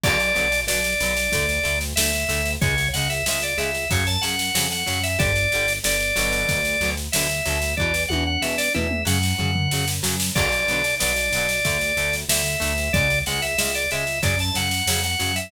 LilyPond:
<<
  \new Staff \with { instrumentName = "Drawbar Organ" } { \time 4/4 \key b \minor \tempo 4 = 93 d''4 d''2 e''4 | cis''8 fis''16 e''16 e''16 d''16 e''8 cis''16 a''16 fis''8. fis''8 e''16 | d''4 d''2 e''4 | d''8 fis''16 fis''16 e''16 d''16 e''8 fis''4. r8 |
d''4 d''2 e''4 | d''8 fis''16 e''16 e''16 d''16 e''8 d''16 a''16 fis''8. fis''8 e''16 | }
  \new Staff \with { instrumentName = "Acoustic Guitar (steel)" } { \time 4/4 \key b \minor <d fis b>8 <d fis b>8 <d fis b>8 <d fis b>8 <d a>8 <d a>8 <d a>8 <d a>8 | <cis gis>8 <cis gis>8 <cis gis>8 <cis gis>8 <cis fis>8 <cis fis>8 <cis fis>8 <cis fis>8 | <d g>8 <d g>8 <d g>8 <b, d fis>4 <b, d fis>8 <b, d fis>8 <b, d fis>8 | <b, e>8 <b, e>8 <b, e>8 <b, e>8 <cis fis>8 <cis fis>8 <cis fis>8 <cis fis>8 |
<d fis b>8 <d fis b>8 <d fis b>8 <d fis b>8 <d a>8 <d a>8 <d a>8 <d a>8 | <cis gis>8 <cis gis>8 <cis gis>8 <cis gis>8 <cis fis>8 <cis fis>8 <cis fis>8 <cis fis>8 | }
  \new Staff \with { instrumentName = "Synth Bass 1" } { \clef bass \time 4/4 \key b \minor b,,8 b,,8 b,,8 b,,8 d,8 d,8 d,8 d,8 | cis,8 cis,8 cis,8 cis,8 fis,8 fis,8 f,8 fis,8 | g,,8 g,,8 g,,8 g,,8 d,8 d,8 d,8 d,8 | e,8 e,8 e,8 e,8 fis,8 fis,8 fis,8 fis,8 |
b,,8 b,,8 b,,8 b,,8 d,8 d,8 d,8 d,8 | cis,8 cis,8 cis,8 cis,8 fis,8 fis,8 f,8 fis,8 | }
  \new DrumStaff \with { instrumentName = "Drums" } \drummode { \time 4/4 <cymc bd sn>16 sn16 sn16 sn16 sn16 sn16 sn16 sn16 <bd sn>16 sn16 sn16 sn16 sn16 sn16 sn16 sn16 | <bd sn>16 sn16 sn16 sn16 sn16 sn16 sn16 sn16 <bd sn>16 sn16 sn16 sn16 sn16 sn16 sn16 sn16 | <bd sn>16 sn16 sn16 sn16 sn16 sn16 sn16 sn16 <bd sn>16 sn16 sn16 sn16 sn16 sn16 sn16 sn16 | bd16 sn16 tommh8 sn16 sn16 toml16 toml16 sn16 sn16 tomfh16 tomfh16 sn16 sn16 sn16 sn16 |
<cymc bd sn>16 sn16 sn16 sn16 sn16 sn16 sn16 sn16 <bd sn>16 sn16 sn16 sn16 sn16 sn16 sn16 sn16 | <bd sn>16 sn16 sn16 sn16 sn16 sn16 sn16 sn16 <bd sn>16 sn16 sn16 sn16 sn16 sn16 sn16 sn16 | }
>>